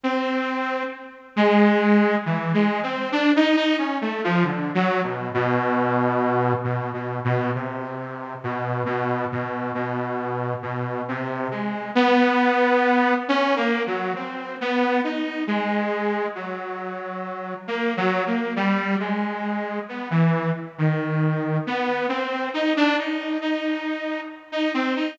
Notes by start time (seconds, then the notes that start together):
0.03 C4
1.36 G#3
2.26 E3
2.54 G#3
2.83 C4
3.12 D4
3.36 D#4
3.56 D#4
3.78 C#4
4.01 A3
4.24 F3
4.44 D3
4.75 F#3
5.04 B2
5.34 B2
6.64 B2
6.93 B2
7.25 B2
7.55 C3
8.44 B2
8.85 B2
9.32 B2
9.75 B2
10.63 B2
11.08 C3
11.51 G#3
11.95 B3
13.28 C#4
13.56 A#3
13.87 F#3
14.16 C4
14.61 B3
15.04 D#4
15.47 G#3
16.35 F#3
17.67 A#3
17.97 F#3
18.27 A#3
18.56 G3
19.00 G#3
19.89 B3
20.11 E3
20.78 D#3
21.67 B3
22.09 C4
22.54 D#4
22.77 D4
22.98 D#4
23.41 D#4
24.52 D#4
24.74 C4
24.96 D#4